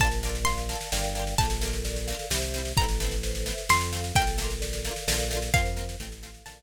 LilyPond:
<<
  \new Staff \with { instrumentName = "Pizzicato Strings" } { \time 3/4 \key bes \lydian \tempo 4 = 130 a''4 c'''2 | a''2. | bes''2 c'''4 | g''2. |
f''2 a''4 | }
  \new Staff \with { instrumentName = "Harpsichord" } { \time 3/4 \key bes \lydian <bes d' f' a'>8 <bes d' f' a'>4 <bes d' f' a'>8 <bes d' f' g'>8 <bes d' f' g'>8 | <a bes d' f'>8 <a bes d' f'>4 <a bes d' f'>8 <g c' e'>8 <g c' e'>8 | <a b c' e'>8 <a b c' e'>4 <a b c' e'>8 <a c' f'>8 <a c' f'>8 | <a bes d' f'>8 <a bes d' f'>4 <a bes d' f'>8 <a bes d' f'>8 <a bes d' f'>8 |
<bes c' f'>8 <bes c' f'>8 <a c' f'>8 <a c' f'>8 <a bes d' f'>8 r8 | }
  \new Staff \with { instrumentName = "Vibraphone" } { \time 3/4 \key bes \lydian bes'8 d''8 f''8 a''8 <bes' d'' f'' g''>4 | a'8 bes'8 d''8 f''8 <g' c'' e''>4 | a'8 b'8 c''8 e''8 a'8 f''8 | a'8 bes'8 d''8 f''8 <a' bes' d'' f''>4 |
<bes' c'' f''>4 a'8 f''8 <a' bes' d'' f''>4 | }
  \new Staff \with { instrumentName = "Synth Bass 1" } { \clef bass \time 3/4 \key bes \lydian bes,,2 g,,4 | bes,,2 c,4 | a,,2 f,4 | bes,,2 bes,,4 |
f,4 a,,4 bes,,4 | }
  \new DrumStaff \with { instrumentName = "Drums" } \drummode { \time 3/4 <bd sn>16 sn16 sn16 sn16 sn16 sn16 sn16 sn16 sn16 sn16 sn16 sn16 | <bd sn>16 sn16 sn16 sn16 sn16 sn16 sn16 sn16 sn16 sn16 sn16 sn16 | <bd sn>16 sn16 sn16 sn16 sn16 sn16 sn16 sn16 sn16 sn16 sn16 sn16 | <bd sn>16 sn16 sn16 sn16 sn16 sn16 sn16 sn16 sn16 sn16 sn16 sn16 |
<bd sn>16 sn16 sn16 sn16 sn16 sn16 sn16 sn16 sn16 sn8. | }
>>